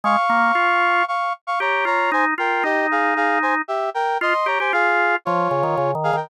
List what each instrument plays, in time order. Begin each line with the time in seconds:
0.04 drawbar organ G#3, brass section F5 C#6
0.29 drawbar organ A#3
0.55 drawbar organ F4
1.08 brass section F5 C#6
1.47 brass section F5 C#6
1.60 drawbar organ G4, brass section C#5 A#5
1.85 drawbar organ F4, brass section C#5 A#5
2.12 drawbar organ D#4, brass section C5 G#5
2.38 drawbar organ F4, brass section A#4 G5
2.63 drawbar organ D#4, brass section G4 D#5
2.91 brass section G#4 F5
3.16 brass section G#4 F5
3.42 brass section C5 G#5
3.68 brass section G4 E5
3.94 brass section A#4 G5
4.21 drawbar organ F4, brass section D#5 C6
4.46 drawbar organ G4, brass section C#5 A#5
4.60 drawbar organ G4, brass section C5 G#5
4.73 drawbar organ F4, brass section G#4 F5
5.25 drawbar organ F3, brass section F4 C#5
5.51 drawbar organ C#3
5.63 drawbar organ D#3
5.77 drawbar organ C#3
5.95 drawbar organ D#3
6.04 brass section G#4 F5
6.13 drawbar organ D#3, brass section A#4 G5